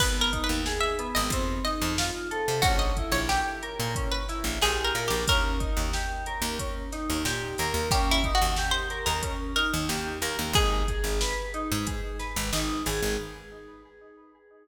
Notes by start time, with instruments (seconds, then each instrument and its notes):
0.00 electric bass (finger) G#1, electric piano 2 B3, pizzicato strings B4, kick, crash
0.21 pizzicato strings A#4
0.32 electric piano 2 D#4, kick, closed hi-hat
0.44 pizzicato strings B4
0.49 electric bass (finger) D#2
0.66 electric piano 2 G#4, snare
0.80 pizzicato strings E5
0.99 electric piano 2 B3, closed hi-hat
1.15 electric bass (finger) G#1, pizzicato strings D#5
1.30 electric bass (finger) F2, electric piano 2 C4, kick, closed hi-hat
1.65 electric piano 2 D#4, pizzicato strings D#5, snare, closed hi-hat
1.82 electric bass (finger) F2
1.98 electric piano 2 F4, snare
2.31 electric piano 2 A4, closed hi-hat
2.48 electric bass (finger) C3
2.62 electric bass (finger) A#1, electric piano 2 C#4, pizzicato strings F#4, kick, closed hi-hat
2.79 pizzicato strings D#5
2.97 electric piano 2 E4, kick, closed hi-hat
3.12 electric bass (finger) A#1, pizzicato strings C#5
3.29 pizzicato strings G4, electric piano 2 G4, snare
3.62 electric piano 2 A#4, closed hi-hat
3.80 electric bass (finger) A#2
3.95 electric piano 2 C#4, kick, closed hi-hat
4.12 pizzicato strings B4
4.29 electric piano 2 E4, snare, closed hi-hat
4.44 electric bass (finger) A#1
4.61 electric bass (finger) A#1, electric piano 2 G4, pizzicato strings G#4, snare
4.84 pizzicato strings A#4
4.95 electric bass (finger) A#2, electric piano 2 A#4, closed hi-hat
5.08 electric bass (finger) A#1, pizzicato strings G4
5.28 electric bass (finger) D#2, electric piano 2 C#4, pizzicato strings A#4, kick, closed hi-hat
5.60 electric piano 2 D#4, kick, closed hi-hat
5.77 electric bass (finger) D#2
5.93 electric piano 2 G4, snare
6.26 electric piano 2 A#4, closed hi-hat
6.42 electric bass (finger) D#2
6.59 electric piano 2 C#4, kick, closed hi-hat
6.92 electric piano 2 D#4, snare, closed hi-hat
7.10 electric bass (finger) D#2
7.25 electric bass (finger) A#2, electric piano 2 G4, snare
7.58 electric bass (finger) D#2, electric piano 2 A#4, closed hi-hat
7.74 electric bass (finger) D#2
7.91 electric bass (finger) D#2, electric piano 2 C#4, pizzicato strings G4, kick, closed hi-hat
8.11 pizzicato strings E4
8.24 electric piano 2 D#4, kick, closed hi-hat
8.35 pizzicato strings F#4
8.42 electric bass (finger) D#2
8.56 electric piano 2 G4, snare
8.71 pizzicato strings C5
8.90 electric piano 2 A#4, closed hi-hat
9.06 electric bass (finger) D#2, pizzicato strings A#4
9.23 electric piano 2 C#4, kick, closed hi-hat
9.56 electric piano 2 D#4, pizzicato strings A#4, snare, closed hi-hat
9.73 electric bass (finger) D#2
9.88 electric bass (finger) D#2, electric piano 2 G4, snare
10.21 electric bass (finger) D#2, electric piano 2 A#4, closed hi-hat
10.39 electric bass (finger) D#2
10.53 electric bass (finger) G#1, electric piano 2 D#4, pizzicato strings G#4, kick, closed hi-hat
10.88 electric piano 2 G#4, kick, closed hi-hat
11.04 electric bass (finger) G#1
11.21 electric piano 2 B4, snare
11.54 electric piano 2 D#4, closed hi-hat
11.72 electric bass (finger) G#2
11.87 electric piano 2 G#4, kick, closed hi-hat
12.19 electric piano 2 B4, snare, closed hi-hat
12.36 electric bass (finger) G#1
12.53 electric bass (finger) G#1, electric piano 2 D#4, snare
12.86 electric bass (finger) G#1, electric piano 2 G#4, open hi-hat
13.02 electric bass (finger) G#1